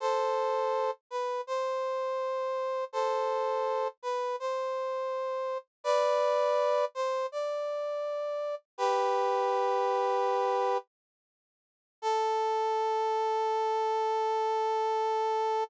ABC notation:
X:1
M:4/4
L:1/8
Q:1/4=82
K:Am
V:1 name="Brass Section"
[Ac]3 B c4 | [Ac]3 B c4 | [Bd]3 c d4 | "^rit." [GB]6 z2 |
A8 |]